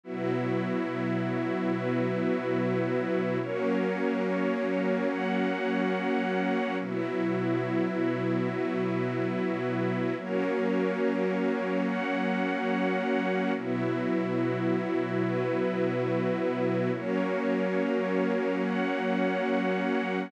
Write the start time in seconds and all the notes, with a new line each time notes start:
0.04 B2 F#3 B3 E4 F#4
1.72 B3 F#4 B4
3.40 F#3 A#3 C#4 F#4 A#4 C#5
5.11 F#4 C#5 F#5
6.79 B2 F#3 B3 E4 F#4
8.49 B3 F#4 B4
10.17 F#3 A#3 C#4 F#4 A#4 C#5
11.86 F#4 C#5 F#5
13.55 B2 F#3 B3 E4 F#4
15.24 B3 F#4 B4
16.92 F#3 A#3 C#4 F#4 A#4 C#5
18.62 F#4 C#5 F#5